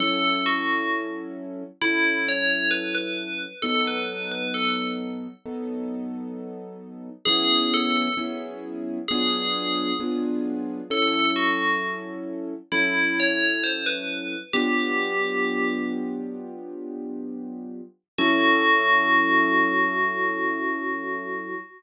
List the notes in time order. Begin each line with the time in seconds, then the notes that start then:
0.00 F#3 C#4 E4 A4
0.46 F#4
1.81 F#3 C#4 E4 A4
2.28 C#5
2.71 B4
2.95 B4
3.62 F#3 B3 D#4 A4
3.87 B4
4.31 B4
4.54 A4
5.45 F#3 B3 D#4 A4
7.25 F#3 B3 C#4 E4 G#4
7.74 A4
8.17 F#3 B3 C#4 E4 G#4
9.08 F#3 B3 D4 F4 G#4
10.00 F#3 B3 D4 F4 G#4
10.90 F#3 C#4 E4 A4
11.36 F#4
12.72 F#3 C#4 E4 A4
13.20 C#5
13.64 C5
13.86 B4
14.53 F#3 B3 D4 F4 G4
18.18 F#3 C#4 E4 F#4 A4